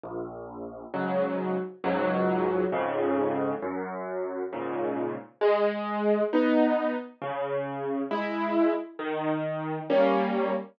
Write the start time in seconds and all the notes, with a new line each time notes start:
0.04 A#1
0.94 G#2 C#3 F#3
1.84 C#2 G#2 F#3
2.72 F2 G#2 C#3
3.62 F#2
4.53 G#2 A#2 C#3
5.41 G#3
6.33 B3 D#4
7.22 C#3
8.11 G#3 E4
8.99 D#3
9.90 G3 A#3 C#4